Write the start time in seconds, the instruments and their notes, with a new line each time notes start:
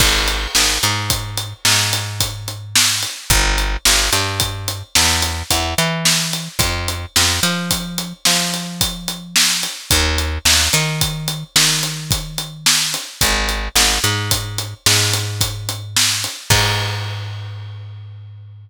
0.00 electric bass (finger) G#1, kick, crash
0.28 closed hi-hat
0.55 electric bass (finger) G#1, snare
0.83 electric bass (finger) G#2, closed hi-hat
1.10 kick, closed hi-hat
1.37 closed hi-hat
1.65 electric bass (finger) G#2, snare
1.93 closed hi-hat
2.20 kick, closed hi-hat
2.48 closed hi-hat
2.75 snare
3.03 closed hi-hat
3.30 electric bass (finger) G1, kick, closed hi-hat
3.58 closed hi-hat
3.85 electric bass (finger) G1, snare
4.13 electric bass (finger) G2, closed hi-hat
4.40 kick, closed hi-hat
4.68 closed hi-hat
4.95 electric bass (finger) E2, snare
5.22 closed hi-hat
5.50 electric bass (finger) E2, kick, closed hi-hat
5.78 electric bass (finger) E3, closed hi-hat
6.05 snare
6.33 closed hi-hat
6.59 electric bass (finger) F2, kick, closed hi-hat
6.88 closed hi-hat
7.16 electric bass (finger) F2, snare
7.43 electric bass (finger) F3, closed hi-hat
7.71 kick, closed hi-hat
7.98 closed hi-hat
8.25 electric bass (finger) F3, snare
8.54 closed hi-hat
8.81 kick, closed hi-hat
9.08 closed hi-hat
9.36 snare
9.63 closed hi-hat
9.91 electric bass (finger) D#2, kick, closed hi-hat
10.18 closed hi-hat
10.45 electric bass (finger) D#2, snare
10.73 electric bass (finger) D#3, closed hi-hat
11.01 kick, closed hi-hat
11.28 closed hi-hat
11.56 electric bass (finger) D#3, snare
11.83 closed hi-hat
12.11 kick, closed hi-hat
12.38 closed hi-hat
12.66 snare
12.94 closed hi-hat
13.21 electric bass (finger) G#1, kick, closed hi-hat
13.49 closed hi-hat
13.75 electric bass (finger) G#1, snare
14.04 electric bass (finger) G#2, closed hi-hat
14.31 kick, closed hi-hat
14.58 closed hi-hat
14.86 electric bass (finger) G#2, snare
15.13 closed hi-hat
15.41 kick, closed hi-hat
15.69 closed hi-hat
15.96 snare
16.24 closed hi-hat
16.50 electric bass (finger) G#2, kick, crash